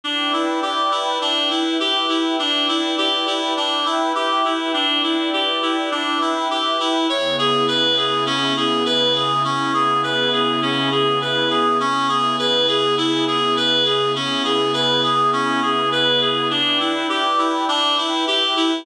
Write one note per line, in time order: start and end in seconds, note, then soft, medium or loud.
0.04 0.31 D4 medium
0.04 1.21 E4 medium
0.04 1.21 B4 medium
0.04 1.21 D5 medium
0.04 1.21 G5 medium
0.33 0.60 E4 medium
0.62 0.89 G4 medium
0.92 1.19 E4 medium
1.21 1.49 D4 medium
1.21 2.37 E4 medium
1.21 2.37 B4 medium
1.21 2.38 E5 medium
1.21 2.37 G5 medium
1.50 1.78 E4 medium
1.80 2.07 G4 medium
2.09 2.36 E4 medium
2.38 2.66 D4 medium
2.38 3.54 E4 medium
2.38 3.54 B4 medium
2.38 3.54 D5 medium
2.38 3.54 G5 medium
2.69 2.95 E4 medium
2.98 3.25 G4 medium
3.27 3.54 E4 medium
3.56 3.84 D4 medium
3.56 4.73 E4 medium
3.56 4.73 B4 medium
3.56 4.73 E5 medium
3.56 4.73 G5 medium
3.86 4.13 E4 medium
4.15 4.42 G4 loud
4.45 4.72 E4 medium
4.74 5.01 D4 medium
4.74 5.91 E4 medium
4.74 5.91 B4 medium
4.74 5.91 D5 medium
4.74 5.91 G5 medium
5.03 5.30 E4 medium
5.33 5.60 G4 medium
5.62 5.90 E4 medium
5.91 6.19 D4 medium
5.91 7.07 E4 medium
5.91 7.07 B4 medium
5.91 7.07 E5 medium
5.91 7.07 G5 medium
6.21 6.48 E4 medium
6.51 6.78 G4 medium
6.80 7.07 E4 medium
7.09 9.42 C#3 loud
7.09 9.42 B3 medium
7.09 9.42 E4 loud
7.09 9.42 G#4 medium
7.09 7.36 C#5 medium
7.39 7.66 G#4 medium
7.68 7.95 B4 loud
7.97 8.24 G#4 medium
8.26 8.54 C#4 loud
8.57 8.84 G#4 medium
8.86 9.13 B4 loud
9.15 9.43 G#4 medium
9.43 11.76 C#3 loud
9.43 11.76 B3 loud
9.43 9.72 C#4 medium
9.43 11.76 E4 loud
9.43 11.76 G#4 loud
9.74 10.01 G#4 medium
10.03 10.31 B4 medium
10.33 10.60 G#4 medium
10.62 10.89 C#4 loud
10.92 11.19 G#4 medium
11.22 11.49 B4 medium
11.51 11.78 G#4 medium
11.80 14.13 C#3 medium
11.80 14.13 B3 medium
11.80 12.07 C#4 loud
11.80 14.13 E4 medium
11.80 14.13 G#4 loud
12.09 12.36 G#4 loud
12.39 12.66 B4 loud
12.68 12.95 G#4 loud
12.98 13.25 E4 loud
13.27 13.55 G#4 medium
13.57 13.84 B4 loud
13.86 14.13 G#4 medium
14.15 16.48 C#3 loud
14.15 16.48 B3 loud
14.15 14.43 C#4 medium
14.15 16.48 E4 loud
14.15 16.48 G#4 loud
14.45 14.72 G#4 medium
14.74 15.01 B4 loud
15.04 15.31 G#4 loud
15.33 15.60 C#4 loud
15.63 15.90 G#4 medium
15.92 16.19 B4 loud
16.21 16.48 G#4 medium
16.51 16.78 D4 loud
16.51 17.67 E4 medium
16.51 17.67 B4 medium
16.51 17.67 D5 medium
16.51 17.67 G5 medium
16.80 17.07 E4 medium
17.09 17.36 G4 loud
17.38 17.66 E4 medium
17.68 17.95 D4 loud
17.68 18.84 E4 medium
17.68 18.84 B4 medium
17.68 18.84 E5 medium
17.68 18.84 G5 medium
17.98 18.25 E4 medium
18.27 18.54 G4 loud
18.57 18.84 E4 medium